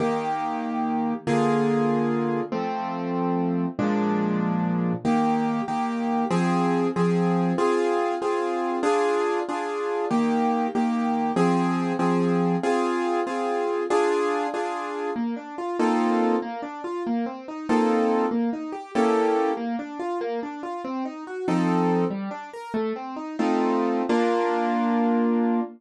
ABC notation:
X:1
M:6/8
L:1/8
Q:3/8=95
K:Eb
V:1 name="Acoustic Grand Piano"
[E,B,G]6 | [D,B,FA]6 | [F,=A,C]6 | [B,,F,A,D]6 |
[E,B,G]3 [E,B,G]3 | [F,CA]3 [F,CA]3 | [CFA]3 [CFA]3 | [DFA]3 [DFA]3 |
[E,B,G]3 [E,B,G]3 | [F,CA]3 [F,CA]3 | [CFA]3 [CFA]3 | [DFA]3 [DFA]3 |
[K:Bb] B, D F [B,CEFA]3 | B, D F B, C E | [B,CEFA]3 B, E G | [B,^C=EGA]3 B, D F |
B, D F C E _G | [F,CEA]3 G, D B | "^rit." A, C E [A,CEF]3 | [B,DF]6 |]